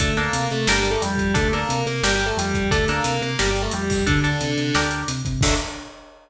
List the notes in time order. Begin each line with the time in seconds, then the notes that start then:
0.00 D2 A3 D4 A4, kick, closed hi-hat
0.17 A#3 D4 A4 A#4, closed hi-hat
0.33 C3, closed hi-hat
0.50 C3 A3 A4, closed hi-hat
0.67 G1 G3 D4 G4 A#4, snare
0.79 G3 G4
0.85 closed hi-hat
0.90 A3 A4
1.01 F2 G3 G4, closed hi-hat
1.18 F2, kick, closed hi-hat
1.34 D2 A3 D4 A4, kick, closed hi-hat
1.52 A#3 D4 A4 A#4, closed hi-hat
1.69 C3, closed hi-hat
1.86 C3 A#3 A#4, closed hi-hat
2.03 G1 G3 D4 G4 A#4, snare
2.15 G3 G4
2.20 closed hi-hat
2.26 A3 A4
2.37 F2 G3 G4, closed hi-hat
2.54 F2, kick, closed hi-hat
2.71 D2 A3 D4 A4, kick, closed hi-hat
2.88 A#3 D4 A4 A#4, closed hi-hat
3.04 C3, closed hi-hat
3.21 C3 A#3 A#4, closed hi-hat
3.39 G1 G3 D4 G4 A#4, snare
3.50 G3 G4
3.55 closed hi-hat
3.62 A3 A4
3.71 F2 G3 G4, closed hi-hat
3.90 F2, kick, open hi-hat
4.06 D2 D3 D4 A4, kick, closed hi-hat
4.24 D4 A4, closed hi-hat
4.41 C3, closed hi-hat
4.58 C3, closed hi-hat
4.75 D2 D4 G4 A#4, snare
4.91 closed hi-hat
5.08 C3, closed hi-hat
5.25 C3, kick, closed hi-hat
5.41 D2 D3 A3 D4, kick, crash